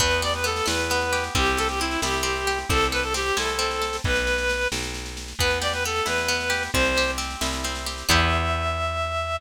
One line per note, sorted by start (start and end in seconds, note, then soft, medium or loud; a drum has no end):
0.00 0.61 E2 medium
0.00 0.43 B3 loud
0.00 0.21 B4 loud
0.00 kick loud
0.00 snare medium
0.11 snare medium
0.22 1.12 G4 medium
0.22 0.33 D5 loud
0.22 snare medium
0.34 0.45 B4 loud
0.34 snare medium
0.44 0.90 B3 medium
0.44 0.67 A4 loud
0.44 snare medium
0.56 snare medium
0.66 1.29 E2 medium
0.66 1.30 E4 medium
0.66 1.24 B4 loud
0.66 snare loud
0.79 snare medium
0.90 1.34 B3 medium
0.90 snare loud
1.01 snare medium
1.12 1.34 G4 medium
1.12 snare medium
1.24 snare medium
1.35 1.97 C2 medium
1.35 1.80 C4 loud
1.35 1.58 G4 loud
1.35 kick loud
1.35 snare medium
1.46 snare medium
1.57 2.47 G4 medium
1.57 1.68 A4 loud
1.57 snare medium
1.69 1.80 G4 medium
1.69 snare medium
1.80 2.22 C4 medium
1.80 2.01 E4 medium
1.80 snare medium
1.91 snare medium
2.02 2.64 C2 medium
2.02 2.67 E4 medium
2.02 2.58 G4 medium
2.02 snare loud
2.13 snare medium
2.23 2.66 C4 medium
2.23 snare medium
2.36 snare medium
2.47 2.68 G4 medium
2.47 snare medium
2.58 snare medium
2.69 3.31 C2 medium
2.69 3.14 C4 medium
2.69 2.87 A4 loud
2.69 kick loud
2.69 snare medium
2.81 snare medium
2.92 3.81 A4 medium
2.92 3.03 B4 loud
2.92 snare medium
3.03 3.14 A4 loud
3.03 snare medium
3.14 3.58 C4 medium
3.14 3.38 G4 loud
3.14 snare loud
3.26 snare medium
3.36 3.99 C2 medium
3.36 4.01 E4 medium
3.36 3.97 A4 medium
3.36 snare loud
3.48 snare medium
3.59 4.01 C4 medium
3.59 snare medium
3.71 snare medium
3.82 4.03 A4 medium
3.82 snare medium
3.93 snare medium
4.04 4.67 B1 medium
4.04 4.68 B4 loud
4.04 kick loud
4.04 snare medium
4.16 snare medium
4.27 snare medium
4.38 snare medium
4.49 snare medium
4.61 snare medium
4.72 5.34 B1 medium
4.72 snare loud
4.83 snare medium
4.94 snare medium
5.06 snare medium
5.17 snare medium
5.28 snare medium
5.39 6.01 E2 medium
5.39 5.85 B3 loud
5.39 5.59 B4 loud
5.39 kick loud
5.39 snare medium
5.51 snare medium
5.62 6.49 G4 medium
5.62 5.73 D5 loud
5.62 snare loud
5.73 5.84 B4 loud
5.73 snare medium
5.84 6.28 B3 medium
5.84 6.07 A4 loud
5.84 snare medium
5.96 snare medium
6.06 6.69 E2 medium
6.06 6.70 E4 medium
6.06 6.63 B4 loud
6.06 snare loud
6.18 snare medium
6.28 6.71 B3 medium
6.28 snare medium
6.40 snare medium
6.50 6.71 G4 medium
6.50 snare medium
6.63 snare medium
6.73 7.36 C2 medium
6.73 7.17 C4 loud
6.73 7.11 C5 loud
6.73 kick loud
6.73 snare medium
6.85 snare medium
6.97 7.86 G4 medium
6.97 snare medium
7.08 snare medium
7.18 7.64 C4 medium
7.18 snare medium
7.30 snare medium
7.41 8.03 C2 medium
7.41 8.05 E4 medium
7.41 snare loud
7.53 snare medium
7.64 8.07 C4 medium
7.64 snare medium
7.75 snare medium
7.86 8.08 G4 medium
7.86 snare medium
7.98 snare medium
8.08 9.38 E2 loud
8.08 9.37 B3 loud
8.08 9.37 E4 loud
8.08 9.37 G4 loud
8.08 9.37 E5 loud
8.08 kick loud
8.08 crash loud